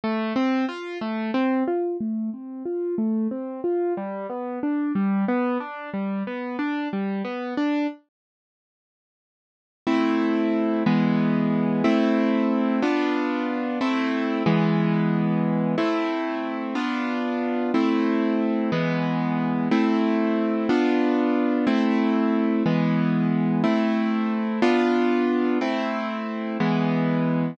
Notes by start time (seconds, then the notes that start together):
0.04 A3
0.36 C4
0.69 F4
1.01 A3
1.34 C4
1.68 F4
2.00 A3
2.33 C4
2.65 F4
2.98 A3
3.31 C4
3.64 F4
3.97 G3
4.30 B3
4.63 D4
4.95 G3
5.28 B3
5.60 D4
5.94 G3
6.27 B3
6.59 D4
6.93 G3
7.25 B3
7.57 D4
9.87 A3 C4 E4
10.86 E3 G#3 B3
11.84 A3 C4 E4
12.83 B3 D4 F4
13.81 A3 C4 E4
14.46 E3 G#3 B3
15.78 A3 C4 E4
16.75 B3 D4 F4
17.74 A3 C4 E4
18.72 E3 G#3 B3
19.71 A3 C4 E4
20.69 B3 D4 F4
21.67 A3 C4 E4
22.66 E3 G#3 B3
23.64 A3 C4 E4
24.62 B3 D4 F4
25.61 A3 C4 E4
26.60 E3 G#3 B3